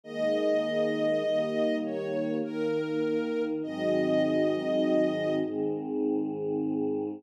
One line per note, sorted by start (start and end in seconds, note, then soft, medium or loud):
0.04 1.23 D#3 medium
0.04 1.23 G#3 medium
0.04 1.23 A#3 medium
0.04 1.76 D#5 loud
1.23 2.42 D#3 medium
1.23 2.42 G3 medium
1.23 2.42 A#3 loud
1.84 2.36 C#5 medium
2.43 3.62 D#3 medium
2.43 3.62 A#3 medium
2.43 3.62 D#4 medium
2.43 3.43 A#4 loud
3.63 5.42 G#2 medium
3.63 5.42 D#3 medium
3.63 5.42 F#3 medium
3.63 5.42 C4 medium
3.63 5.34 D#5 loud
5.44 7.22 G#2 medium
5.44 7.22 D#3 medium
5.44 7.22 G#3 medium
5.44 7.22 C4 medium